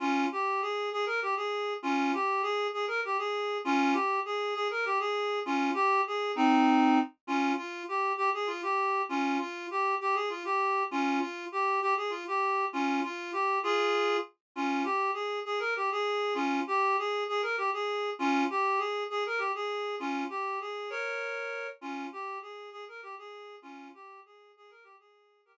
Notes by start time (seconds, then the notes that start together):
0.00 C#4 F4
0.32 G4
0.62 G#4
0.92 G#4
1.06 A#4
1.22 G4
1.36 G#4
1.83 C#4 F4
2.14 G4
2.42 G#4
2.73 G#4
2.88 A#4
3.05 G4
3.18 G#4
3.65 C#4 F4
3.93 G4
4.25 G#4
4.55 G#4
4.71 A#4
4.85 G4
4.99 G#4
5.46 C#4 F4
5.74 G4
6.07 G#4
6.36 C4 D#4
7.27 C#4 F4
7.57 F4
7.88 G4
8.17 G4
8.34 G#4
8.47 F4
8.62 G4
9.09 C#4 F4
9.39 F4
9.71 G4
10.01 G4
10.15 G#4
10.30 F4
10.45 G4
10.91 C#4 F4
11.20 F4
11.52 G4
11.81 G4
11.97 G#4
12.10 F4
12.27 G4
12.73 C#4 F4
13.03 F4
13.33 G4
13.63 F4 G#4
14.56 C#4 F4
14.84 G4
15.14 G#4
15.45 G#4
15.59 A#4
15.76 G4
15.92 G#4
16.35 C#4 F4
16.67 G4
16.98 G#4
17.29 G#4
17.42 A#4
17.58 G4
17.73 G#4
18.19 C#4 F4
18.50 G4
18.78 G#4
19.10 G#4
19.26 A#4
19.38 G4
19.55 G#4
19.99 C#4 F4
20.30 G4
20.61 G#4
20.90 A#4 C#5
21.81 C#4 F4
22.12 G4
22.42 G#4
22.72 G#4
22.88 A#4
23.03 G4
23.18 G#4
23.62 C#4 F4
23.94 G4
24.26 G#4
24.57 G#4
24.70 A#4
24.84 G4
24.99 G#4
25.45 G4 A#4